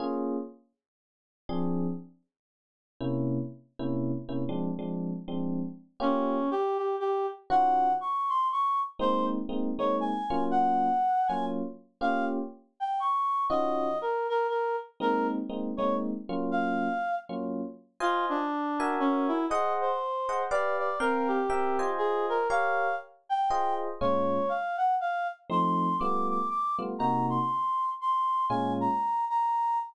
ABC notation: X:1
M:3/4
L:1/8
Q:"Swing" 1/4=120
K:Bbm
V:1 name="Clarinet"
z6 | z6 | z6 | z6 |
D2 =G G G z | g2 d' c' d' z | c z2 d a2 | g3 a z2 |
f z2 =g d'2 | e2 B B B z | B z2 d z2 | f3 z3 |
[K:Fm] F =D3 _D _F | e c3 =d d | B G3 A B | f2 z g2 z |
[K:Bbm] d2 f g f z | c'2 =d' d' d' z | b c'3 c'2 | a b2 b2 z |]
V:2 name="Electric Piano 1"
[B,DFA]6 | [F,C=DA]6 | [C,B,D=E]3 [C,B,DE]2 [C,B,DE] | [F,A,C=D] [F,A,CD]2 [F,A,CD]3 |
[B,DF=G]6 | [E,DFG]6 | [A,B,CE]2 [A,B,CE] [A,B,CE]2 [G,B,DF]- | [G,B,DF]3 [G,B,DF]3 |
[B,DF=G]6 | [E,DFG]6 | [A,B,CE]2 [A,B,CE] [A,B,CE]2 [G,B,DF]- | [G,B,DF]3 [G,B,DF]3 |
[K:Fm] [Fcea]3 [_GB_fa]3 | [Ace_g]3 [Aceg] [=G=B=df]2 | [CBfg]2 [CB=eg] [Fc_ea]3 | [GBdf]4 [FAce]2 |
[K:Bbm] [B,,A,DF]6 | [F,=A,CE]2 [=G,A,=B,F]3 [G,A,B,F] | [C,B,EG]6 | [B,,A,DF]6 |]